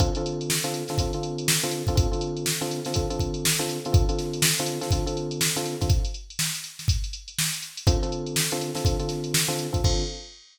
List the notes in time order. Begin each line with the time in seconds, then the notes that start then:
0.00 D3 C4 F4 A4, kick, closed hi-hat
0.15 D3 C4 F4 A4, closed hi-hat
0.26 closed hi-hat
0.41 closed hi-hat
0.50 snare
0.64 D3 C4 F4 A4, closed hi-hat
0.74 closed hi-hat
0.88 D3 C4 F4 A4, snare, closed hi-hat
0.98 D3 C4 F4 A4, kick, closed hi-hat
1.13 D3 C4 F4 A4, closed hi-hat
1.23 closed hi-hat
1.38 closed hi-hat
1.48 snare
1.63 D3 C4 F4 A4, closed hi-hat
1.71 closed hi-hat
1.87 D3 C4 F4 A4, kick, closed hi-hat
1.95 D3 C4 F4 A4, kick, closed hi-hat
2.12 D3 C4 F4 A4, closed hi-hat
2.21 closed hi-hat
2.37 closed hi-hat
2.46 snare
2.61 D3 C4 F4 A4, closed hi-hat
2.71 closed hi-hat
2.85 D3 C4 F4 A4, snare, closed hi-hat
2.94 D3 C4 F4 A4, kick, closed hi-hat
3.10 D3 C4 F4 A4, closed hi-hat
3.19 kick, closed hi-hat
3.34 closed hi-hat
3.45 snare
3.59 D3 C4 F4 A4, closed hi-hat
3.69 closed hi-hat
3.85 D3 C4 F4 A4, closed hi-hat
3.92 D3 C4 F4 A4, kick, closed hi-hat
4.09 D3 C4 F4 A4, closed hi-hat
4.19 snare, closed hi-hat
4.33 closed hi-hat
4.42 snare
4.58 D3 C4 F4 A4, closed hi-hat
4.66 closed hi-hat
4.81 D3 C4 F4 A4, snare, closed hi-hat
4.91 D3 C4 F4 A4, kick, closed hi-hat
5.06 D3 C4 F4 A4, closed hi-hat
5.17 closed hi-hat
5.31 closed hi-hat
5.41 snare
5.56 D3 C4 F4 A4, closed hi-hat
5.66 closed hi-hat
5.81 D3 C4 F4 A4, kick, snare, closed hi-hat
5.89 kick, closed hi-hat
6.05 closed hi-hat
6.14 closed hi-hat
6.30 closed hi-hat
6.39 snare
6.55 closed hi-hat
6.64 closed hi-hat
6.79 snare, closed hi-hat
6.88 kick, closed hi-hat
7.04 closed hi-hat
7.13 closed hi-hat
7.28 closed hi-hat
7.39 snare
7.53 closed hi-hat
7.62 closed hi-hat
7.77 closed hi-hat
7.87 D3 C4 F4 A4, kick, closed hi-hat
8.03 D3 C4 F4 A4, closed hi-hat
8.12 closed hi-hat
8.26 closed hi-hat
8.36 snare
8.52 D3 C4 F4 A4, closed hi-hat
8.61 closed hi-hat
8.75 D3 C4 F4 A4, snare, closed hi-hat
8.85 D3 C4 F4 A4, kick, closed hi-hat
8.99 D3 C4 F4 A4, closed hi-hat
9.09 snare, closed hi-hat
9.24 closed hi-hat
9.34 snare
9.48 D3 C4 F4 A4, snare, closed hi-hat
9.59 closed hi-hat
9.73 D3 C4 F4 A4, kick, closed hi-hat
9.84 D3 C4 F4 A4, kick, crash